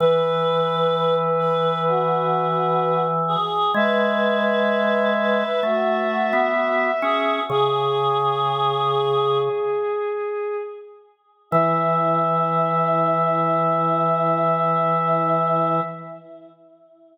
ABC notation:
X:1
M:4/4
L:1/16
Q:1/4=64
K:E
V:1 name="Violin"
B16 | e16 | "^rit." G14 z2 | e16 |]
V:2 name="Choir Aahs"
B6 B2 F6 G2 | B6 B2 F6 G2 | "^rit." G8 z8 | E16 |]
V:3 name="Drawbar Organ"
E,16 | G,8 A,3 B,3 C2 | "^rit." C,10 z6 | E,16 |]